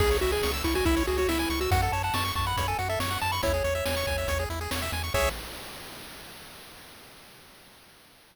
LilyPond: <<
  \new Staff \with { instrumentName = "Lead 1 (square)" } { \time 4/4 \key cis \minor \tempo 4 = 140 gis'8 fis'16 gis'8 r16 e'16 fis'16 e'8 fis'16 fis'16 e'8. fis'16 | fis''16 fis''16 a''16 a''16 cis'''8 cis'''16 b''8 gis''16 fis''16 e''16 cis'''8 a''16 b''16 | cis''2~ cis''8 r4. | cis''4 r2. | }
  \new Staff \with { instrumentName = "Lead 1 (square)" } { \time 4/4 \key cis \minor gis'16 cis''16 e''16 gis''16 cis'''16 e'''16 cis'''16 gis''16 e''16 cis''16 gis'16 cis''16 e''16 gis''16 cis'''16 e'''16 | fis'16 a'16 cis''16 fis''16 a''16 cis'''16 a''16 fis''16 cis''16 a'16 fis'16 a'16 cis''16 fis''16 a''16 cis'''16 | e'16 gis'16 cis''16 e''16 gis''16 cis'''16 gis''16 e''16 cis''16 gis'16 e'16 gis'16 cis''16 e''16 gis''16 cis'''16 | <gis' cis'' e''>4 r2. | }
  \new Staff \with { instrumentName = "Synth Bass 1" } { \clef bass \time 4/4 \key cis \minor cis,8 cis,8 cis,8 cis,8 cis,8 cis,8 cis,8 cis,8 | fis,8 fis,8 fis,8 fis,8 fis,8 fis,8 fis,8 fis,8 | e,8 e,8 e,8 e,8 e,8 e,8 e,8 e,8 | cis,4 r2. | }
  \new DrumStaff \with { instrumentName = "Drums" } \drummode { \time 4/4 <cymc bd>16 hh16 hh16 hh16 sn16 hh16 <hh bd>16 hh16 <hh bd>16 hh16 hh16 hh16 sn16 hh16 hh16 hh16 | <hh bd>16 hh16 hh16 hh16 sn16 hh16 <hh bd>16 hh16 <hh bd>16 hh16 hh16 hh16 sn16 hh16 hh16 hh16 | <hh bd>16 hh16 hh16 hh16 sn16 hh16 <hh bd>16 hh16 <hh bd>16 hh16 hh16 hh16 sn16 hh16 hh16 hh16 | <cymc bd>4 r4 r4 r4 | }
>>